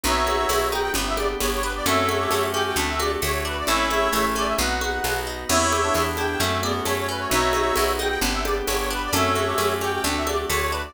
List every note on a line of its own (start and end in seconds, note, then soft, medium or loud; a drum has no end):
0.04 0.45 B1 medium
0.04 0.49 B3 loud
0.04 0.94 B3 medium
0.04 0.46 D#4 medium
0.04 0.94 D#4 medium
0.04 0.46 F#4 loud
0.04 0.94 F#4 medium
0.04 0.69 C#5 medium
0.04 0.69 E5 loud
0.04 low conga medium
0.27 0.92 F#4 medium
0.27 high conga medium
0.49 0.90 B1 medium
0.49 0.93 B3 medium
0.49 tambourine medium
0.49 high conga medium
0.71 0.94 D#4 medium
0.71 0.81 G5 medium
0.71 high conga medium
0.81 0.92 G5 loud
0.94 1.36 G1 medium
0.94 1.40 B3 loud
0.94 1.86 B3 medium
0.94 1.86 D4 medium
0.94 1.86 G4 medium
0.94 low conga medium
1.06 1.17 E5 medium
1.17 1.82 G4 medium
1.17 1.28 D5 loud
1.17 high conga medium
1.40 1.82 G1 medium
1.40 1.84 B3 medium
1.40 1.51 C#5 medium
1.40 tambourine medium
1.40 high conga medium
1.53 1.63 C#5 medium
1.62 1.85 D4 medium
1.62 1.73 B4 loud
1.75 1.86 D5 loud
1.86 2.27 F#2 medium
1.86 2.31 A3 loud
1.86 2.77 A3 medium
1.86 2.77 C#4 medium
1.86 2.77 F#4 medium
1.86 2.18 A4 loud
1.86 2.46 C#5 medium
1.86 2.46 E5 medium
1.86 low conga medium
2.09 2.73 F#4 medium
2.09 high conga medium
2.20 2.49 G4 loud
2.31 2.72 F#2 medium
2.31 2.75 A3 medium
2.31 tambourine medium
2.31 high conga medium
2.53 2.76 C#4 medium
2.53 2.75 G4 loud
2.53 2.64 G5 medium
2.53 high conga medium
2.65 2.76 G5 medium
2.76 3.17 D2 medium
2.76 3.22 A3 loud
2.76 3.67 A3 medium
2.76 2.96 D4 loud
2.76 3.67 D4 medium
2.76 3.67 F#4 medium
2.76 low conga medium
2.89 2.99 E5 medium
3.00 3.64 F#4 medium
3.00 3.19 G4 medium
3.00 3.11 D5 medium
3.00 high conga medium
3.22 3.63 D2 medium
3.22 3.65 A3 medium
3.22 3.32 C#5 medium
3.22 tambourine medium
3.22 high conga medium
3.33 3.43 C#5 medium
3.45 3.66 D4 medium
3.45 3.57 B4 medium
3.58 3.69 D5 medium
3.67 4.09 A1 medium
3.67 4.13 A3 loud
3.67 4.59 A3 medium
3.67 4.59 C#4 medium
3.67 3.89 E4 loud
3.67 4.59 E4 medium
3.67 4.25 C#5 medium
3.67 4.25 E5 loud
3.67 low conga medium
3.90 4.09 E4 loud
3.90 4.55 E4 medium
3.90 high conga medium
4.13 4.54 A1 medium
4.13 4.56 A3 medium
4.13 4.52 A3 loud
4.13 tambourine medium
4.13 high conga medium
4.36 4.57 C#4 medium
4.36 4.48 D5 loud
4.36 high conga soft
4.46 4.57 E5 medium
4.58 5.00 B1 medium
4.58 5.48 B3 medium
4.58 5.04 B3 loud
4.58 5.48 D#4 medium
4.58 5.48 F#4 medium
4.58 5.17 F#5 medium
4.58 low conga medium
4.81 5.46 F#4 medium
4.81 high conga medium
5.04 5.45 B1 medium
5.04 5.47 B3 medium
5.04 tambourine medium
5.04 high conga medium
5.27 5.48 D#4 medium
5.48 5.90 E2 medium
5.48 6.39 B3 medium
5.48 5.72 B3 loud
5.48 5.78 E4 loud
5.48 6.39 E4 medium
5.48 6.39 G4 medium
5.48 6.05 C#5 loud
5.48 6.05 E5 loud
5.48 crash medium
5.48 low conga medium
5.72 5.95 G4 medium
5.72 high conga medium
5.83 6.14 D4 loud
5.95 6.36 E2 medium
5.95 6.18 B3 medium
5.95 tambourine medium
5.95 high conga medium
6.17 6.39 D4 loud
6.17 6.39 E4 medium
6.17 6.28 G5 medium
6.17 high conga medium
6.30 6.40 G5 medium
6.40 6.81 F#2 medium
6.40 6.60 A3 loud
6.40 6.63 A3 loud
6.40 7.30 A3 medium
6.40 7.30 C#4 medium
6.40 7.29 F#4 medium
6.40 low conga medium
6.50 6.61 E5 medium
6.62 6.82 B3 loud
6.62 6.86 F#4 medium
6.62 6.73 D5 medium
6.62 high conga medium
6.86 7.27 F#2 medium
6.86 7.09 A3 medium
6.86 6.97 C#5 loud
6.86 tambourine medium
6.86 high conga medium
6.97 7.08 C#5 medium
7.09 7.30 C#4 medium
7.09 7.21 B4 medium
7.19 7.29 C#5 medium
7.29 7.72 B1 medium
7.29 8.20 B3 medium
7.29 7.54 B3 loud
7.29 8.20 D#4 medium
7.29 7.75 D#4 medium
7.29 8.20 F#4 medium
7.29 7.75 F#4 loud
7.29 7.93 C#5 medium
7.29 7.93 E5 loud
7.29 low conga medium
7.53 7.77 F#4 medium
7.53 high conga medium
7.76 8.18 B1 medium
7.76 8.00 B3 medium
7.76 tambourine medium
7.76 high conga medium
7.99 8.21 D#4 medium
7.99 8.08 G5 medium
7.99 high conga medium
8.09 8.20 G5 loud
8.21 8.62 G1 medium
8.21 9.11 B3 medium
8.21 8.45 B3 loud
8.21 9.11 D4 medium
8.21 9.11 G4 medium
8.21 low conga medium
8.33 8.43 E5 medium
8.45 8.68 G4 medium
8.45 8.55 D5 loud
8.45 high conga medium
8.66 9.09 G1 medium
8.66 8.90 B3 medium
8.66 8.77 C#5 medium
8.66 tambourine medium
8.66 high conga medium
8.79 8.89 C#5 medium
8.91 9.12 D4 medium
8.91 9.02 B4 loud
9.04 9.15 D5 loud
9.13 9.54 F#2 medium
9.13 9.36 A3 loud
9.13 10.04 A3 medium
9.13 10.04 C#4 medium
9.13 10.04 F#4 medium
9.13 9.45 A4 loud
9.13 9.73 C#5 medium
9.13 9.73 E5 medium
9.13 low conga medium
9.35 9.59 F#4 medium
9.35 high conga medium
9.47 9.77 G4 loud
9.58 9.99 F#2 medium
9.58 9.81 A3 medium
9.58 tambourine medium
9.58 high conga medium
9.81 10.03 C#4 medium
9.81 10.03 G4 loud
9.81 9.93 G5 medium
9.81 high conga medium
9.93 10.04 G5 medium
10.04 10.45 D2 medium
10.04 10.27 A3 loud
10.04 10.94 A3 medium
10.04 10.23 D4 loud
10.04 10.94 D4 medium
10.04 10.94 F#4 medium
10.04 low conga medium
10.17 10.28 E5 medium
10.27 10.50 F#4 medium
10.27 10.45 G4 medium
10.27 10.38 D5 medium
10.27 high conga medium
10.50 10.91 D2 medium
10.50 10.72 A3 medium
10.50 10.60 C#5 medium
10.50 tambourine medium
10.50 high conga medium
10.61 10.71 C#5 medium
10.71 10.94 D4 medium
10.71 10.82 B4 medium
10.85 10.94 D5 medium